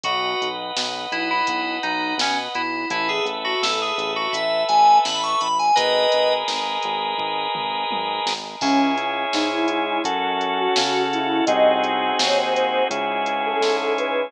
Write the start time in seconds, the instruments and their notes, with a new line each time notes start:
0.04 synth bass 1 B1, electric piano 2 F#4, drawbar organ B4 D#5 F#5, kick, closed hi-hat
0.42 synth bass 1 B1, closed hi-hat
0.76 synth bass 1 B1, snare
1.12 synth bass 1 B1, electric piano 2 E4, closed hi-hat
1.31 electric piano 2 E4
1.47 synth bass 1 B1, kick, closed hi-hat
1.83 synth bass 1 B1, electric piano 2 D#4, closed hi-hat
2.18 synth bass 1 B1, electric piano 2 C#4, snare
2.55 synth bass 1 B1, electric piano 2 E4, closed hi-hat
2.90 synth bass 1 A1, electric piano 2 E4, drawbar organ A4 B4 E5, kick, closed hi-hat
3.09 electric piano 2 G#4
3.24 synth bass 1 A1, closed hi-hat
3.45 electric piano 2 F#4
3.62 synth bass 1 A1, electric piano 2 A4, snare
3.82 electric piano 2 G#4
3.98 synth bass 1 A1, closed hi-hat
4.16 electric piano 2 F#4
4.33 synth bass 1 A1, electric piano 2 E5, kick, closed hi-hat
4.68 synth bass 1 A1, electric piano 2 G#5, closed hi-hat
5.05 synth bass 1 A1, electric piano 2 B5, snare
5.23 electric piano 2 C#6
5.40 synth bass 1 A1, electric piano 2 B5, closed hi-hat
5.59 electric piano 2 G#5
5.76 synth bass 1 G#1, drawbar organ G#4 A#4 B4 D#5, electric piano 2 B4 D#5, kick, closed hi-hat
6.12 synth bass 1 G#1, closed hi-hat
6.48 synth bass 1 G#1, snare
6.83 synth bass 1 G#1, closed hi-hat
7.17 synth bass 1 G#1, kick
7.55 synth bass 1 G#1, mid tom
7.90 synth bass 1 G#1, high tom
8.26 synth bass 1 G#1, snare
8.61 synth bass 1 C#2, ocarina C#4, drawbar organ C#4 E4 G#4, kick, crash
8.97 closed hi-hat
9.33 synth bass 1 G#2, drawbar organ G#3 C#4 G#4, ocarina D#4, snare
9.51 ocarina E4
9.68 ocarina E4, closed hi-hat
10.04 synth bass 1 F#2, drawbar organ C#4 F#4 A4, kick, closed hi-hat
10.41 closed hi-hat
10.58 ocarina F#4
10.76 synth bass 1 C#3, drawbar organ C#4 A4 C#5, snare
11.13 ocarina E4, closed hi-hat
11.46 synth bass 1 C2, drawbar organ C4 D#4 F#4 G#4, ocarina D#5, kick, closed hi-hat
11.84 closed hi-hat
12.19 synth bass 1 D#2, drawbar organ C4 D#4 G#4 C5, ocarina C#5, snare
12.37 ocarina C5
12.54 ocarina C5, closed hi-hat
12.90 synth bass 1 C#2, drawbar organ C#4 E4 G#4, kick, closed hi-hat
13.26 closed hi-hat
13.46 ocarina A4
13.60 synth bass 1 G#2, drawbar organ G#3 C#4 G#4, snare
13.98 ocarina B4, closed hi-hat